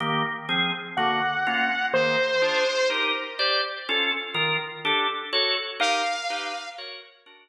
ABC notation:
X:1
M:6/8
L:1/8
Q:3/8=124
K:Ab
V:1 name="Lead 2 (sawtooth)"
z6 | ^f6 | c6 | z6 |
z6 | z6 | f6 | z6 |]
V:2 name="Drawbar Organ"
[E,B,G]3 [F,CA]3 | [=D,^A,^F]3 [B,_D=F]3 | [E,B,A]3 [=DFA]3 | [EGB]3 [Gc=d]3 |
[DF=A]3 [E,FB]3 | [=DG=A]3 [_GA_d]3 | [EGB]3 [EG=B]3 | [_GBd]3 [=D^F^A]3 |]